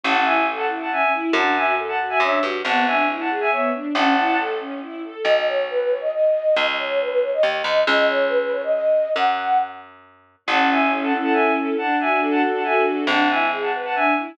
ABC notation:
X:1
M:3/4
L:1/16
Q:1/4=138
K:A
V:1 name="Violin"
[fa]2 [eg]2 z [fa] z [fa] [eg]2 z2 | [fa]2 [eg]2 z [fa] z [eg] [ce]2 z2 | [fa]2 [eg]2 z [fa] z [eg] [ce]2 z2 | [fa]4 z8 |
[K:B] z12 | z12 | z12 | z12 |
[K:A] [fa]2 [eg]2 z [fa] z [fa] [eg]2 z2 | [fa]2 [eg]2 z [fa] z [fa] [eg]2 z2 | [fa]2 [eg]2 z [fa] z [fa] [eg]2 z2 |]
V:2 name="Flute"
z12 | z12 | z12 | z12 |
[K:B] d d c2 B B c d d4 | d d c2 B B c d d4 | d d c2 B B c d d4 | f4 z8 |
[K:A] z12 | z12 | z12 |]
V:3 name="String Ensemble 1"
C2 E2 A2 E2 C2 E2 | D2 F2 A2 F2 D2 F2 | B,2 D2 E2 G2 B,2 D2 | C2 E2 A2 C2 E2 A2 |
[K:B] z12 | z12 | z12 | z12 |
[K:A] C2 E2 A2 C2 E2 A2 | D2 F2 A2 D2 F2 A2 | D2 E2 G2 B2 D2 E2 |]
V:4 name="Electric Bass (finger)" clef=bass
A,,,12 | F,,8 F,,2 =G,,2 | G,,,12 | A,,,12 |
[K:B] B,,,12 | C,,8 D,,2 =D,,2 | C,,12 | F,,12 |
[K:A] A,,,12 | z12 | G,,,12 |]